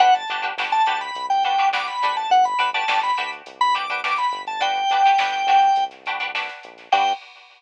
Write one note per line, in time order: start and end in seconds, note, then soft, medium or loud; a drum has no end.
0.00 0.25 G1 medium
0.00 0.22 D4 loud
0.00 0.22 F#4 loud
0.00 0.22 G4 loud
0.00 0.22 B4 loud
0.00 0.14 F#5 medium
0.00 kick loud
0.00 closed hi-hat loud
0.15 0.41 A5 medium
0.15 closed hi-hat medium
0.28 0.53 G1 medium
0.28 0.42 D4 medium
0.28 0.42 F#4 loud
0.28 0.42 G4 loud
0.28 0.42 B4 medium
0.28 closed hi-hat medium
0.42 0.54 D4 medium
0.42 0.54 F#4 loud
0.42 0.54 G4 medium
0.42 0.54 B4 medium
0.42 closed hi-hat medium
0.57 0.82 G1 medium
0.57 0.82 D4 loud
0.57 0.82 F#4 loud
0.57 0.82 G4 medium
0.57 0.82 B4 medium
0.57 snare loud
0.72 1.00 A5 medium
0.72 closed hi-hat medium
0.86 1.11 D2 medium
0.86 1.32 D4 medium
0.86 1.32 F#4 loud
0.86 1.32 G4 loud
0.86 1.32 B4 medium
0.86 closed hi-hat loud
1.01 1.26 B5 medium
1.01 closed hi-hat medium
1.15 1.90 C2 medium
1.15 kick loud
1.15 closed hi-hat loud
1.30 1.44 G5 medium
1.30 closed hi-hat loud
1.43 1.56 D4 medium
1.43 1.56 F#4 loud
1.43 1.56 G4 medium
1.43 1.56 B4 medium
1.43 1.69 G5 medium
1.43 closed hi-hat medium
1.58 1.70 D4 medium
1.58 1.70 F#4 medium
1.58 1.70 G4 medium
1.58 1.70 B4 loud
1.58 closed hi-hat medium
1.73 2.00 D4 loud
1.73 2.00 F#4 medium
1.73 2.00 G4 medium
1.73 2.00 B4 medium
1.73 1.87 D6 medium
1.73 snare loud
1.87 2.16 B5 medium
1.87 closed hi-hat medium
2.01 2.27 A#1 medium
2.01 2.55 D4 loud
2.01 2.55 F#4 loud
2.01 2.55 G4 loud
2.01 2.55 B4 loud
2.01 snare medium
2.01 closed hi-hat medium
2.16 2.30 A5 medium
2.16 closed hi-hat medium
2.30 2.54 G1 loud
2.30 2.45 F#5 medium
2.30 kick loud
2.30 closed hi-hat loud
2.44 2.70 B5 medium
2.44 closed hi-hat loud
2.59 2.84 G1 medium
2.59 2.70 D4 loud
2.59 2.70 F#4 medium
2.59 2.70 G4 medium
2.59 2.70 B4 loud
2.59 closed hi-hat loud
2.74 2.86 D4 medium
2.74 2.86 F#4 loud
2.74 2.86 G4 loud
2.74 2.86 B4 loud
2.74 2.99 A5 medium
2.74 snare soft
2.74 closed hi-hat medium
2.88 3.13 G1 medium
2.88 3.11 D4 medium
2.88 3.11 F#4 medium
2.88 3.11 G4 loud
2.88 3.11 B4 medium
2.88 snare loud
3.03 3.31 B5 medium
3.03 closed hi-hat loud
3.17 3.42 D2 medium
3.17 3.64 D4 medium
3.17 3.64 F#4 loud
3.17 3.64 G4 medium
3.17 3.64 B4 medium
3.17 closed hi-hat medium
3.33 closed hi-hat medium
3.46 4.20 C2 medium
3.46 kick loud
3.46 closed hi-hat loud
3.61 3.75 B5 medium
3.61 closed hi-hat medium
3.75 3.86 D4 medium
3.75 3.86 F#4 medium
3.75 3.86 G4 medium
3.75 3.86 B4 loud
3.75 4.00 D6 medium
3.75 closed hi-hat loud
3.89 4.01 D4 loud
3.89 4.01 F#4 loud
3.89 4.01 G4 medium
3.89 4.01 B4 medium
3.89 kick loud
3.89 closed hi-hat medium
4.04 4.50 D4 medium
4.04 4.50 F#4 medium
4.04 4.50 G4 medium
4.04 4.50 B4 medium
4.04 4.18 D6 medium
4.04 snare loud
4.18 4.42 B5 medium
4.18 closed hi-hat medium
4.32 4.85 G1 medium
4.32 closed hi-hat medium
4.47 4.61 A5 medium
4.47 closed hi-hat medium
4.60 4.83 D4 loud
4.60 4.83 F#4 loud
4.60 4.83 G4 loud
4.60 4.83 B4 loud
4.60 5.84 G5 loud
4.60 kick loud
4.60 closed hi-hat loud
4.76 closed hi-hat medium
4.89 5.15 G1 medium
4.89 5.03 D4 medium
4.89 5.03 F#4 medium
4.89 5.03 G4 loud
4.89 5.03 B4 loud
4.89 closed hi-hat loud
5.05 5.17 D4 medium
5.05 5.17 F#4 medium
5.05 5.17 G4 medium
5.05 5.17 B4 medium
5.05 closed hi-hat medium
5.18 5.44 G1 medium
5.18 5.42 D4 loud
5.18 5.42 F#4 medium
5.18 5.42 G4 medium
5.18 5.42 B4 loud
5.18 snare loud
5.33 closed hi-hat medium
5.47 5.71 D2 medium
5.47 5.94 D4 medium
5.47 5.94 F#4 loud
5.47 5.94 G4 medium
5.47 5.94 B4 medium
5.47 closed hi-hat loud
5.61 closed hi-hat medium
5.76 6.49 C2 medium
5.76 kick loud
5.76 closed hi-hat loud
5.91 snare soft
5.91 closed hi-hat medium
6.06 6.18 D4 loud
6.06 6.18 F#4 medium
6.06 6.18 G4 medium
6.06 6.18 B4 medium
6.06 snare soft
6.06 closed hi-hat medium
6.20 6.31 D4 medium
6.20 6.31 F#4 medium
6.20 6.31 G4 medium
6.20 6.31 B4 loud
6.20 closed hi-hat medium
6.35 6.81 D4 loud
6.35 6.81 F#4 medium
6.35 6.81 G4 medium
6.35 6.81 B4 loud
6.35 snare loud
6.49 snare medium
6.49 closed hi-hat loud
6.63 6.89 A#1 medium
6.63 closed hi-hat loud
6.78 snare medium
6.78 closed hi-hat medium
6.92 7.13 G2 loud
6.92 7.12 D4 loud
6.92 7.12 F#4 loud
6.92 7.12 G4 loud
6.92 7.12 B4 loud
6.92 7.13 G5 loud
6.92 kick loud
6.92 crash loud